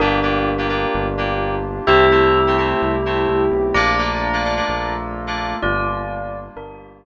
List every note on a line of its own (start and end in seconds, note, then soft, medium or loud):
0.00 0.86 G1 medium
0.00 1.85 A#3 medium
0.00 0.19 A#3 medium
0.00 1.61 D4 loud
0.00 1.85 D4 medium
0.00 0.19 D4 medium
0.00 1.85 F4 medium
0.00 0.19 F4 loud
0.00 1.85 G4 medium
0.00 0.19 G4 medium
0.00 1.61 A#4 loud
0.22 0.51 A#3 medium
0.22 0.51 D4 medium
0.22 0.51 F4 medium
0.22 0.51 G4 medium
0.58 0.67 A#3 medium
0.58 0.67 D4 medium
0.58 0.67 F4 medium
0.58 0.67 G4 medium
0.69 1.06 A#3 medium
0.69 1.06 D4 medium
0.69 1.06 F4 medium
0.69 1.06 G4 medium
0.94 1.80 G1 medium
1.18 1.55 A#3 medium
1.18 1.55 D4 medium
1.18 1.55 F4 medium
1.18 1.55 G4 medium
1.87 2.74 C2 medium
1.87 2.05 A3 medium
1.87 3.73 A3 medium
1.87 2.05 C4 loud
1.87 3.73 C4 medium
1.87 2.05 E4 loud
1.87 3.73 E4 medium
1.87 2.05 G4 medium
1.87 3.64 G4 loud
1.87 3.73 G4 loud
1.87 3.64 E5 loud
2.11 2.39 A3 medium
2.11 2.39 C4 medium
2.11 2.39 E4 medium
2.11 2.39 G4 medium
2.47 2.56 A3 medium
2.47 2.56 C4 medium
2.47 2.56 E4 medium
2.47 2.56 G4 medium
2.58 2.95 A3 medium
2.58 2.95 C4 medium
2.58 2.95 E4 medium
2.58 2.95 G4 medium
2.82 3.26 C2 medium
3.06 3.43 A3 medium
3.06 3.43 C4 medium
3.06 3.43 E4 medium
3.06 3.43 G4 medium
3.28 3.49 C2 medium
3.52 3.73 B1 medium
3.74 4.61 A#1 medium
3.74 4.67 A3 medium
3.74 4.67 A#3 medium
3.74 3.94 A#3 medium
3.74 4.67 D4 medium
3.74 3.94 D4 medium
3.74 4.67 F4 loud
3.74 3.94 F4 medium
3.74 3.94 A4 loud
3.74 5.49 D5 loud
3.74 5.49 A#5 loud
3.98 4.26 A#3 medium
3.98 4.26 D4 medium
3.98 4.26 F4 medium
3.98 4.26 A4 medium
4.33 4.42 A#3 medium
4.33 4.42 D4 medium
4.33 4.42 F4 medium
4.33 4.42 A4 medium
4.44 4.54 A#3 medium
4.44 4.54 D4 medium
4.44 4.54 F4 medium
4.44 4.54 A4 medium
4.56 4.94 A#3 medium
4.56 4.94 D4 medium
4.56 4.94 F4 medium
4.56 4.94 A4 medium
4.69 5.55 A#1 medium
4.69 5.61 A3 medium
4.69 5.61 A#3 medium
4.69 5.61 F4 medium
4.69 5.61 A4 medium
5.27 5.55 A#3 medium
5.27 5.55 D4 medium
5.27 5.55 F4 medium
5.27 5.55 A4 medium
5.62 6.49 G1 medium
5.62 6.55 G3 medium
5.62 6.55 A#3 medium
5.62 6.55 D4 medium
5.62 6.38 F4 loud
5.62 6.55 F4 medium
5.62 6.38 D5 loud
6.56 7.05 G1 medium
6.56 7.05 G3 medium
6.56 7.05 A#3 medium
6.56 6.99 D4 medium
6.56 7.05 F4 medium
6.56 7.05 G4 medium
6.56 6.99 A#4 loud